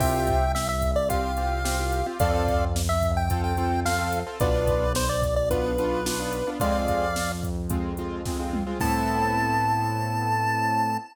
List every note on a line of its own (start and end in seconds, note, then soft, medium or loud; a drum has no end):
0.00 2.03 C2 loud
0.00 0.44 C4 medium
0.00 0.44 F4 loud
0.00 0.44 G4 medium
0.00 0.52 E5 medium
0.00 0.52 G5 medium
0.00 kick loud
0.00 crash loud
0.27 kick loud
0.27 closed hi-hat loud
0.55 0.68 E5 medium
0.55 snare loud
0.69 0.91 E5 medium
0.82 kick medium
0.82 closed hi-hat loud
0.96 1.09 D5 medium
1.09 1.31 C4 medium
1.09 1.31 F4 medium
1.09 1.31 G4 medium
1.09 2.07 F5 medium
1.09 kick loud
1.09 closed hi-hat loud
1.37 1.60 C4 medium
1.37 1.60 F4 medium
1.37 1.60 G4 medium
1.37 closed hi-hat medium
1.65 1.76 C4 loud
1.65 1.76 F4 medium
1.65 1.76 G4 medium
1.65 snare loud
1.79 2.01 C4 medium
1.79 2.01 F4 medium
1.79 2.01 G4 medium
1.92 closed hi-hat medium
2.06 2.17 C4 medium
2.06 2.17 F4 medium
2.06 2.17 G4 medium
2.20 4.23 F2 loud
2.20 2.65 C4 loud
2.20 2.65 F4 loud
2.20 2.65 A4 loud
2.20 2.65 D5 medium
2.20 2.65 F5 medium
2.20 kick loud
2.20 closed hi-hat loud
2.48 kick loud
2.48 closed hi-hat medium
2.76 snare loud
2.89 3.11 E5 medium
3.03 kick loud
3.03 closed hi-hat medium
3.17 3.42 G5 medium
3.30 3.53 C4 medium
3.30 3.53 F4 medium
3.30 3.53 A4 medium
3.30 kick loud
3.30 closed hi-hat loud
3.44 3.80 G5 medium
3.57 3.80 C4 medium
3.57 3.80 F4 medium
3.57 3.80 A4 medium
3.57 closed hi-hat medium
3.85 3.97 C4 medium
3.85 3.97 F4 medium
3.85 3.97 A4 medium
3.85 4.19 F5 medium
3.85 snare loud
3.98 4.20 C4 medium
3.98 4.20 F4 medium
3.98 4.20 A4 medium
4.13 closed hi-hat loud
4.27 4.38 C4 medium
4.27 4.38 F4 medium
4.27 4.38 A4 medium
4.40 6.43 B1 loud
4.40 4.85 B3 loud
4.40 4.85 D4 loud
4.40 4.85 F4 loud
4.40 4.93 B4 medium
4.40 4.93 D5 medium
4.40 kick loud
4.40 closed hi-hat loud
4.67 kick loud
4.67 closed hi-hat loud
4.95 5.09 C5 medium
4.95 snare loud
5.09 5.35 D5 medium
5.22 kick loud
5.22 closed hi-hat medium
5.36 5.49 D5 medium
5.51 5.73 B3 loud
5.51 5.73 D4 medium
5.51 5.73 F4 medium
5.51 6.50 B4 medium
5.51 kick loud
5.51 closed hi-hat loud
5.78 6.01 B3 medium
5.78 6.01 D4 medium
5.78 6.01 F4 loud
5.78 closed hi-hat medium
6.06 6.17 B3 medium
6.06 6.17 D4 medium
6.06 6.17 F4 medium
6.06 snare loud
6.19 6.42 B3 loud
6.19 6.42 D4 medium
6.19 6.42 F4 medium
6.33 closed hi-hat medium
6.47 6.58 B3 medium
6.47 6.58 D4 medium
6.47 6.58 F4 medium
6.60 8.63 F2 loud
6.60 7.05 G#3 loud
6.60 7.05 C4 loud
6.60 7.05 F4 medium
6.60 7.32 D5 medium
6.60 7.32 F5 medium
6.60 kick loud
6.60 closed hi-hat loud
6.88 kick medium
6.88 closed hi-hat medium
7.16 snare loud
7.43 kick loud
7.43 closed hi-hat medium
7.70 7.92 G#3 medium
7.70 7.92 C4 medium
7.70 7.92 F4 medium
7.70 kick loud
7.70 closed hi-hat loud
7.97 8.21 G#3 medium
7.97 8.21 C4 medium
7.97 8.21 F4 medium
7.97 closed hi-hat medium
8.25 8.37 G#3 medium
8.25 8.37 C4 medium
8.25 8.37 F4 medium
8.25 kick loud
8.25 snare loud
8.39 8.61 G#3 medium
8.39 8.61 C4 medium
8.39 8.61 F4 medium
8.53 mid tom loud
8.67 8.78 G#3 medium
8.67 8.78 C4 medium
8.67 8.78 F4 medium
8.80 10.97 A2 loud
8.80 10.97 B3 loud
8.80 10.97 C4 loud
8.80 10.97 E4 loud
8.80 10.97 A4 medium
8.80 10.97 A5 loud
8.80 kick loud
8.80 crash loud